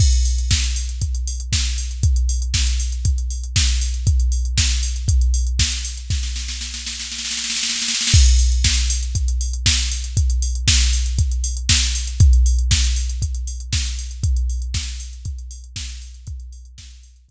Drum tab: CC |x-------------------------------|--------------------------------|--------------------------------|--------------------------------|
HH |--x-o-x---x-o-x-x-x-o-x---x-o-x-|x-x-o-x---x-o-x-x-x-o-x---x-o-x-|x-x-o-x---x-o-x-x-x-o-x---x-o-x-|--------------------------------|
SD |--------o---------------o-------|--------o---------------o-------|--------o---------------o-------|o-o-o-o-o-o-o-o-oooooooooooooooo|
BD |o-------o-------o-------o-------|o-------o-------o-------o-------|o-------o-------o-------o-------|o-------------------------------|

CC |x-------------------------------|--------------------------------|--------------------------------|--------------------------------|
HH |--x-o-x---x-o-x-x-x-o-x---x-o-x-|x-x-o-x---x-o-x-x-x-o-x---x-o-x-|x-x-o-x---x-o-x-x-x-o-x---x-o-x-|x-x-o-x---x-o-x-x-x-o-x---x-o-x-|
SD |--------o---------------o-------|--------o---------------o-------|--------o---------------o-------|--------o---------------o-------|
BD |o-------o-------o-------o-------|o-------o-------o-------o-------|o-------o-------o-------o-------|o-------o-------o-------o-------|

CC |--------------------------------|
HH |x-x-o-x---x-o-x-x---------------|
SD |--------o-----------------------|
BD |o-------o-------o---------------|